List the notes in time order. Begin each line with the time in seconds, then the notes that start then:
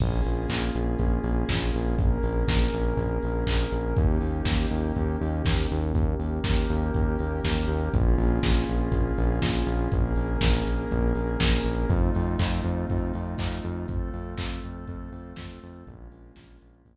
0.00 A#1 A#3 C#4 F4 G#4, kick, crash
0.24 A#1, open hi-hat
0.49 A#1, kick, clap
0.74 A#1, open hi-hat
0.99 A#1, kick, closed hi-hat
1.24 A#1, open hi-hat
1.49 A#1, kick, snare
1.74 A#1, open hi-hat
1.97 A#1 A#3 C#4 G#4 A#4, kick, closed hi-hat
2.23 A#1, open hi-hat
2.48 A#1, kick, snare
2.73 A#1, open hi-hat
2.97 A#1, kick, closed hi-hat
3.23 A#1, open hi-hat
3.46 A#1, kick, clap
3.72 A#1, open hi-hat
3.96 D#2 A#3 C#4 D#4 G4, kick, closed hi-hat
4.21 D#2, open hi-hat
4.45 D#2, kick, snare
4.71 D#2, open hi-hat
4.96 D#2, kick, closed hi-hat
5.21 D#2, open hi-hat
5.45 D#2, kick, snare
5.71 D#2, open hi-hat
5.94 D#2 A#3 C#4 G4 A#4, kick, closed hi-hat
6.19 D#2, open hi-hat
6.44 D#2, kick, snare
6.69 D#2, open hi-hat
6.94 D#2, kick, closed hi-hat
7.19 D#2, open hi-hat
7.44 D#2, kick, snare
7.68 D#2, open hi-hat
7.93 A#1 A#3 C#4 F4 G#4, kick, closed hi-hat
8.18 A#1, open hi-hat
8.43 A#1, kick, snare
8.68 A#1, open hi-hat
8.91 A#1, kick, closed hi-hat
9.18 A#1, open hi-hat
9.42 A#1, kick, snare
9.67 A#1, open hi-hat
9.92 A#1 A#3 C#4 G#4 A#4, kick, closed hi-hat
10.16 A#1, open hi-hat
10.41 A#1, kick, snare
10.65 A#1, open hi-hat
10.91 A#1, kick, closed hi-hat
11.15 A#1, open hi-hat
11.40 A#1, kick, snare
11.64 A#1, open hi-hat
11.89 F2 A3 C4 D#4 F4, kick, closed hi-hat
12.15 F2, open hi-hat
12.39 F2, kick, clap
12.64 F2, open hi-hat
12.90 F2, kick, closed hi-hat
13.14 F2, open hi-hat
13.38 F2, kick, clap
13.64 F2, open hi-hat
13.88 F2 A3 C4 F4 A4, kick, closed hi-hat
14.14 F2, open hi-hat
14.38 F2, kick, clap
14.62 F2, open hi-hat
14.88 F2, kick, closed hi-hat
15.12 F2, open hi-hat
15.36 F2, kick, snare
15.62 F2, open hi-hat
15.86 A#1 G#3 A#3 C#4 F4, kick, closed hi-hat
16.11 A#1, open hi-hat
16.36 A#1, kick, snare
16.61 A#1, open hi-hat
16.85 A#1 G#3 A#3 F4 G#4, kick, closed hi-hat